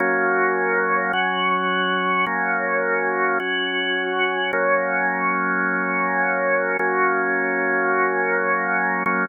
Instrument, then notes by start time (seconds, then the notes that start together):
drawbar organ
0.00 F#3 A#3 C#4
1.13 F#3 C#4 F#4
2.26 F#3 A#3 C#4
3.40 F#3 C#4 F#4
4.53 F#3 A#3 C#4
6.79 F#3 A#3 C#4
9.06 F#3 A#3 C#4